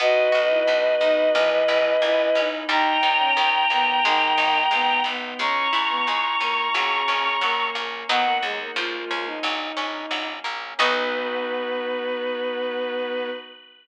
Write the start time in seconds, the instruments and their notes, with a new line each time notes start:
0.00 harpsichord B1 B3, pad 5 (bowed) B3 D#4 F#4, violin F#4 B4 D#5
0.32 harpsichord B1 F#4
0.50 violin E4
0.67 harpsichord B1 B3
1.01 harpsichord B1 D#4, violin D#4
1.35 harpsichord A#1 A#3, violin E3, pad 5 (bowed) A#3 C#4 E4
1.68 harpsichord A#1 E4
2.02 harpsichord A#1 A#3, violin E4
2.35 harpsichord A#1 C#4, violin D#4
2.69 harpsichord D#2 G3, pad 5 (bowed) G3 A#3 D#4, violin D#4 G5 A#5
3.03 harpsichord D#2 D#4
3.19 violin C#4
3.37 harpsichord D#2 G3
3.70 harpsichord D#2 A#3, violin B3
4.04 harpsichord G#1 G#3, violin D#3, pad 5 (bowed) G#3 B3 D#4
4.38 harpsichord G#1 D#4
4.71 harpsichord G#1 G#3, violin B3
5.04 harpsichord G#1 B3, violin B3
5.38 harpsichord C#2 G#3, pad 5 (bowed) G#3 C#4 E4, violin C#4 A#5 C#6
5.73 harpsichord C#2 E4
5.90 violin B3
6.07 harpsichord C#2 G#3
6.40 harpsichord C#2 C#4, violin A#3
6.74 harpsichord A#1 F#3, violin C#3, pad 5 (bowed) F#3 A#3 C#4
7.08 harpsichord A#1 C#4
7.41 harpsichord A#1 F#3, violin A#3
7.75 harpsichord A#1 A#3, violin A#3
8.08 harpsichord D#2 F#3 B3 D#4, pad 5 (bowed) F#3 B3 D#4, violin B3 F#5
8.25 violin A#3
8.42 harpsichord D#2, violin G#3
8.60 violin A#3
8.76 harpsichord C#2 F3, pad 5 (bowed) F3 G#3 C#4, violin F4
9.11 harpsichord C#2 C#4
9.26 violin D#4
9.43 harpsichord A#1 F#3, pad 5 (bowed) F#3 A#3 C#4
9.77 harpsichord A#1 C#4
10.11 harpsichord A#1 F#3
10.44 harpsichord A#1 A#3
10.78 harpsichord B1 B3 D#4 F#4, pad 5 (bowed) B3 D#4 F#4, violin B3 B4